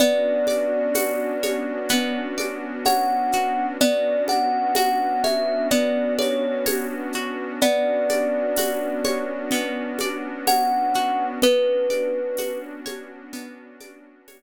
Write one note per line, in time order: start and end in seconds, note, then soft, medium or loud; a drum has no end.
0.00 3.77 B3 medium
0.00 1.89 B3 medium
0.00 3.77 C#4 medium
0.00 3.77 D4 medium
0.00 3.77 F#4 medium
0.00 2.41 D5 loud
0.00 low conga medium
0.00 shaker medium
0.47 2.37 D5 medium
0.47 high conga medium
0.47 shaker medium
0.94 3.33 F#4 medium
0.94 tambourine medium
0.94 high conga medium
0.94 shaker medium
1.43 2.86 C#5 medium
1.43 high conga medium
1.43 shaker medium
1.89 3.71 B3 medium
1.89 low conga medium
1.89 shaker medium
2.38 3.73 D5 medium
2.38 high conga medium
2.38 shaker medium
2.85 3.77 C#5 medium
2.85 3.65 F#5 medium
2.85 tambourine medium
2.85 high conga medium
2.85 shaker medium
3.32 3.79 F#4 medium
3.32 shaker medium
3.80 7.58 B3 medium
3.80 5.71 B3 medium
3.80 7.58 C#4 medium
3.80 7.58 D4 medium
3.80 7.58 F#4 medium
3.80 4.23 D5 loud
3.80 low conga loud
3.80 shaker medium
4.28 6.18 D5 medium
4.28 4.75 F#5 medium
4.28 high conga medium
4.28 shaker medium
4.75 7.14 F#4 medium
4.75 5.22 F#5 medium
4.75 tambourine medium
4.75 high conga medium
4.75 shaker medium
5.24 6.66 C#5 medium
5.24 5.67 E5 medium
5.24 high conga medium
5.24 shaker medium
5.71 7.52 B3 medium
5.71 6.13 D5 medium
5.71 low conga medium
5.71 shaker medium
6.19 6.64 C#5 medium
6.19 7.54 D5 medium
6.19 high conga medium
6.19 shaker medium
6.66 7.57 C#5 medium
6.66 tambourine medium
6.66 high conga medium
6.66 shaker medium
7.13 7.60 F#4 medium
7.13 shaker medium
7.61 11.39 B3 medium
7.61 9.51 B3 medium
7.61 11.39 C#4 medium
7.61 11.39 D4 medium
7.61 11.39 F#4 medium
7.61 9.99 D5 loud
7.61 low conga loud
7.61 shaker medium
8.09 10.00 D5 medium
8.09 high conga medium
8.09 shaker medium
8.56 10.95 F#4 medium
8.56 tambourine medium
8.56 high conga medium
8.56 shaker medium
9.05 10.47 C#5 medium
9.05 high conga medium
9.05 shaker medium
9.51 11.33 B3 medium
9.51 low conga medium
9.51 shaker medium
9.99 11.37 D5 medium
9.99 high conga medium
9.99 shaker medium
10.47 11.38 C#5 medium
10.47 11.25 F#5 loud
10.47 tambourine medium
10.47 high conga medium
10.47 shaker medium
10.94 11.41 F#4 medium
10.94 shaker medium
11.42 14.42 B3 medium
11.42 13.33 B3 medium
11.42 14.42 C#4 medium
11.42 14.42 D4 medium
11.42 14.42 F#4 medium
11.42 12.59 B4 loud
11.42 low conga loud
11.42 shaker medium
11.90 13.80 D5 medium
11.90 high conga medium
11.90 shaker medium
12.37 14.42 F#4 medium
12.37 tambourine medium
12.37 high conga medium
12.37 shaker medium
12.86 14.27 C#5 medium
12.86 high conga medium
12.86 shaker medium
13.33 14.42 B3 medium
13.33 low conga medium
13.33 shaker medium
13.80 14.42 D5 medium
13.80 high conga medium
13.80 shaker medium
14.28 14.42 C#5 medium
14.28 tambourine medium
14.28 high conga medium
14.28 shaker medium